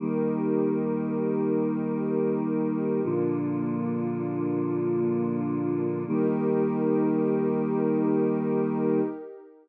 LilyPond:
<<
  \new Staff \with { instrumentName = "Choir Aahs" } { \time 4/4 \key ees \major \tempo 4 = 79 <ees g bes>1 | <bes, d f>1 | <ees g bes>1 | }
  \new Staff \with { instrumentName = "Pad 2 (warm)" } { \time 4/4 \key ees \major <ees' g' bes'>1 | <bes d' f'>1 | <ees' g' bes'>1 | }
>>